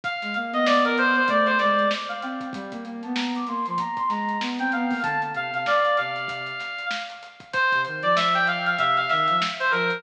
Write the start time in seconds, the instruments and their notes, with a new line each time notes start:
0.04 brass section F5, kick, closed hi-hat
0.22 ocarina G#3, snare, closed hi-hat
0.34 ocarina A#3, closed hi-hat
0.52 ocarina B3, brass section D#5, closed hi-hat
0.66 brass section D5, snare
0.85 brass section A#4, closed hi-hat
0.98 brass section C5, closed hi-hat
1.16 brass section C5, closed hi-hat
1.28 ocarina A3, brass section D5, kick, closed hi-hat
1.46 brass section C5, closed hi-hat
1.59 ocarina G#3, brass section D5, snare, closed hi-hat
1.77 ocarina G#3, closed hi-hat
1.91 snare
2.09 brass section F5, closed hi-hat
2.22 ocarina C4, brass section G5, closed hi-hat
2.40 kick, closed hi-hat
2.53 ocarina G3, brass section G5, kick, closed hi-hat
2.71 ocarina A#3, kick, closed hi-hat
2.85 ocarina A#3, closed hi-hat
3.03 ocarina B3, brass section A5, closed hi-hat
3.15 brass section A#5, snare
3.35 brass section D6, closed hi-hat
3.47 ocarina A#3, brass section C6, closed hi-hat
3.66 ocarina F3, brass section C6, closed hi-hat
3.78 brass section A#5, kick, closed hi-hat
3.97 brass section C6, kick, closed hi-hat
4.09 ocarina G#3, brass section A#5, snare, closed hi-hat
4.29 closed hi-hat
4.41 ocarina B3, snare
4.59 ocarina C4, brass section G5, snare, closed hi-hat
4.72 ocarina B3, brass section F5, closed hi-hat
4.90 ocarina A#3, kick, open hi-hat
5.03 ocarina D3, brass section A5, kick, closed hi-hat
5.22 closed hi-hat
5.34 ocarina C3, brass section F5, closed hi-hat
5.52 ocarina C3, brass section F5, closed hi-hat
5.66 brass section D5, snare
5.85 closed hi-hat
5.97 ocarina C3, brass section F5, closed hi-hat
6.16 closed hi-hat
6.28 kick, closed hi-hat
6.46 closed hi-hat
6.60 snare, closed hi-hat
6.79 closed hi-hat
6.91 snare
7.10 closed hi-hat
7.23 closed hi-hat
7.40 kick, closed hi-hat
7.53 brass section C5, kick, closed hi-hat
7.72 ocarina C3, kick, closed hi-hat
7.85 ocarina D#3, closed hi-hat
8.02 ocarina F3, brass section D5, closed hi-hat
8.16 brass section E5, snare
8.34 brass section G5, snare, closed hi-hat
8.47 brass section F5, closed hi-hat
8.66 brass section F5, closed hi-hat
8.79 ocarina C3, brass section E5, kick, closed hi-hat
8.97 brass section F5, closed hi-hat
9.09 ocarina D#3, brass section E5, snare, closed hi-hat
9.28 ocarina F3, closed hi-hat
9.42 snare
9.60 brass section C5, closed hi-hat
9.71 ocarina F3, brass section A#4, closed hi-hat
9.90 closed hi-hat